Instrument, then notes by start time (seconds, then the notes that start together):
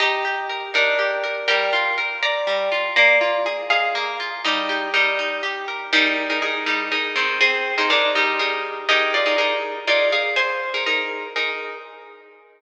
orchestral harp
0.00 D#4 G4 D#5
0.25 G4
0.49 A#4
0.74 D4 D#4 A#4
0.99 G4
1.24 A#4
1.48 G3 A#4 G5
1.73 F4
1.98 A#4
2.23 D5 A#5
2.47 G3
2.72 F4
2.96 A#3 D5 A#5
3.21 F4
3.46 G#4
3.70 G#4 D#5 F5
3.95 A#3
4.20 F4
4.45 G3 D#4
4.69 G4
4.94 G3 D#4 A#4
5.19 D#4
5.43 G4
5.68 A#4
5.93 G3 D#4 G#4 A#4
6.30 D#4 G#4 A#4
6.42 D#4 G#4 A#4
6.66 G3 D#4
6.92 D#4 G#4 A#4
7.16 D#3 C4
7.41 C4 G#4
7.78 D#4 G#4 A#4 C5
7.90 D4 D#4 G#4 A#4
8.15 G3 D#4
8.39 D#4 G#4 A#4
8.89 D#4 G4 G#4 A#4 D#5
9.14 F4 D5
9.26 D#4 G#4 A#4
9.38 D#4 G#4 A#4
9.87 D#4 F4 G#4 A#4 D5
10.12 G#4 F5
10.36 C5 G#5
10.74 D#4 G#4 A#4
10.86 D#4 G#4 A#4
11.36 D#4 G#4 A#4